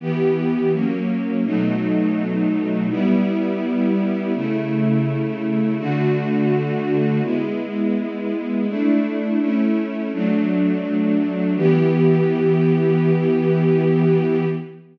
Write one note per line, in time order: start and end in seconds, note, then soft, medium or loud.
0.00 0.72 E3 medium
0.00 0.72 B3 medium
0.00 0.72 G4 medium
0.72 1.44 F#3 medium
0.72 1.44 A#3 medium
0.72 1.44 C#4 medium
1.44 2.88 B2 medium
1.44 2.88 F#3 medium
1.44 2.88 A3 medium
1.44 2.88 D#4 medium
2.89 4.32 G3 medium
2.89 4.32 B3 medium
2.89 4.32 E4 medium
4.34 5.77 C#3 medium
4.34 5.77 A3 medium
4.34 5.77 E4 medium
5.79 7.22 D3 loud
5.79 7.22 A3 medium
5.79 7.22 F#4 medium
7.23 8.66 G#3 medium
7.23 8.66 B3 medium
7.23 8.66 E4 medium
8.67 9.39 A3 medium
8.67 9.39 D4 medium
8.67 9.39 E4 medium
9.40 10.11 A3 medium
9.40 10.11 C#4 medium
9.40 10.11 E4 medium
10.13 11.56 F#3 medium
10.13 11.56 A3 medium
10.13 11.56 D4 medium
11.56 14.45 E3 loud
11.56 14.45 B3 medium
11.56 14.45 G4 medium